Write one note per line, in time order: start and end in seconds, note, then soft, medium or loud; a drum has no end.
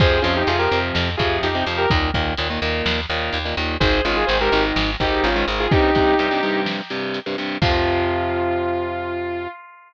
0.00 0.20 F2 loud
0.00 0.19 C3 medium
0.00 0.19 F3 medium
0.00 0.22 G#4 loud
0.00 0.22 C5 loud
0.00 kick loud
0.00 crash medium
0.22 0.44 F2 medium
0.22 0.43 C3 medium
0.22 0.43 F3 medium
0.22 0.33 C#4 medium
0.22 0.33 F4 loud
0.22 closed hi-hat medium
0.36 0.48 D#4 medium
0.36 0.48 G4 loud
0.47 0.68 F2 medium
0.47 0.57 C3 medium
0.47 0.57 F3 medium
0.47 0.59 F4 medium
0.47 0.59 G#4 loud
0.47 closed hi-hat loud
0.59 0.69 C3 medium
0.59 0.69 F3 medium
0.59 0.78 G4 medium
0.59 0.78 A#4 loud
0.71 0.92 F2 medium
0.71 1.10 C3 medium
0.71 1.10 F3 medium
0.71 closed hi-hat medium
0.95 1.16 F2 loud
0.95 snare loud
1.17 1.39 F2 medium
1.17 1.48 C3 medium
1.17 1.48 F3 medium
1.17 1.36 F4 medium
1.17 1.36 G#4 medium
1.17 kick medium
1.17 closed hi-hat medium
1.43 1.63 F2 medium
1.43 1.64 D#4 medium
1.43 1.64 G4 medium
1.43 closed hi-hat loud
1.55 1.64 C3 medium
1.55 1.64 F3 medium
1.66 1.87 F2 medium
1.66 1.86 C3 medium
1.66 1.86 F3 medium
1.66 open hi-hat medium
1.78 1.89 G4 medium
1.78 1.89 A#4 loud
1.90 2.11 D#2 loud
1.90 2.10 A#2 medium
1.90 2.10 D#3 medium
1.90 kick loud
1.90 closed hi-hat loud
2.14 2.35 D#2 medium
2.14 2.33 A#2 medium
2.14 2.33 D#3 medium
2.14 kick medium
2.14 closed hi-hat medium
2.37 2.59 D#2 medium
2.37 2.48 A#2 medium
2.37 2.48 D#3 medium
2.37 closed hi-hat loud
2.50 2.60 A#2 medium
2.50 2.60 D#3 medium
2.62 2.82 D#2 medium
2.62 3.00 A#2 medium
2.62 3.00 D#3 medium
2.62 closed hi-hat medium
2.86 3.06 D#2 loud
2.86 snare loud
3.10 3.30 D#2 medium
3.10 3.38 A#2 medium
3.10 3.38 D#3 medium
3.10 closed hi-hat medium
3.33 3.54 D#2 medium
3.33 closed hi-hat loud
3.45 3.55 A#2 medium
3.45 3.55 D#3 medium
3.57 3.77 D#2 medium
3.57 3.76 A#2 medium
3.57 3.76 D#3 medium
3.57 closed hi-hat medium
3.80 4.01 G#1 loud
3.80 4.00 G#2 medium
3.80 4.00 D#3 medium
3.80 4.02 G#4 medium
3.80 4.02 C5 loud
3.80 kick loud
3.80 closed hi-hat loud
4.05 4.25 G#1 medium
4.05 4.24 G#2 medium
4.05 4.24 D#3 medium
4.05 4.16 C#4 medium
4.05 4.16 F4 medium
4.05 closed hi-hat medium
4.16 4.28 F4 medium
4.16 4.26 G#4 loud
4.27 4.49 G#1 medium
4.27 4.38 G#2 medium
4.27 4.38 D#3 medium
4.27 4.38 G#4 medium
4.27 4.38 C5 loud
4.27 closed hi-hat loud
4.40 4.50 G#2 medium
4.40 4.50 D#3 medium
4.40 4.63 G4 medium
4.40 4.63 A#4 loud
4.52 4.73 G#1 loud
4.52 4.90 G#2 medium
4.52 4.90 D#3 medium
4.52 closed hi-hat medium
4.76 4.96 G#1 loud
4.76 snare loud
5.00 5.20 G#1 medium
5.00 5.29 G#2 medium
5.00 5.29 D#3 medium
5.00 5.24 D#4 medium
5.00 5.24 G4 loud
5.00 kick medium
5.00 closed hi-hat medium
5.24 5.44 G#1 medium
5.24 5.46 C#4 medium
5.24 5.46 F4 loud
5.24 closed hi-hat loud
5.36 5.45 G#2 medium
5.36 5.45 D#3 medium
5.48 5.68 G#1 medium
5.48 5.67 G#2 medium
5.48 5.67 D#3 medium
5.48 closed hi-hat medium
5.60 5.71 F4 medium
5.60 5.71 G#4 loud
5.71 5.90 G2 medium
5.71 5.90 C3 medium
5.71 6.60 D#4 loud
5.71 6.60 G4 loud
5.71 kick loud
5.71 closed hi-hat medium
5.95 6.14 G2 medium
5.95 6.14 C3 medium
5.95 kick medium
5.95 closed hi-hat medium
6.19 6.29 G2 medium
6.19 6.29 C3 medium
6.19 closed hi-hat loud
6.31 6.40 G2 medium
6.31 6.40 C3 medium
6.43 6.81 G2 medium
6.43 6.81 C3 medium
6.43 closed hi-hat medium
6.66 snare loud
6.90 7.19 G2 medium
6.90 7.19 C3 medium
6.90 closed hi-hat medium
7.14 closed hi-hat medium
7.26 7.36 G2 medium
7.26 7.36 C3 medium
7.38 7.57 G2 medium
7.38 7.57 C3 medium
7.38 closed hi-hat medium
7.62 9.47 F2 medium
7.62 9.48 C3 loud
7.62 9.48 F3 loud
7.62 9.48 F4 loud
7.62 kick loud
7.62 crash loud